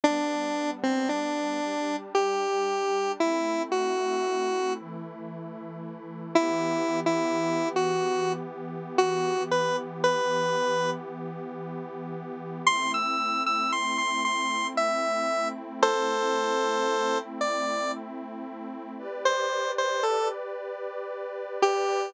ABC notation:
X:1
M:3/4
L:1/16
Q:1/4=57
K:G
V:1 name="Lead 1 (square)"
D3 C D4 G4 | E2 F4 z6 | [K:Em] (3E4 E4 F4 z2 F2 | B z B4 z6 |
c' e'2 e' c' c' c'2 e3 z | [Ac]6 d2 z4 | [K:G] z c2 c A z5 G2 |]
V:2 name="Pad 5 (bowed)"
[G,B,D]6 [G,DG]6 | [A,CE]6 [E,A,E]6 | [K:Em] [E,B,G]12- | [E,B,G]12 |
[A,CE]12- | [A,CE]12 | [K:G] [GBd]12 |]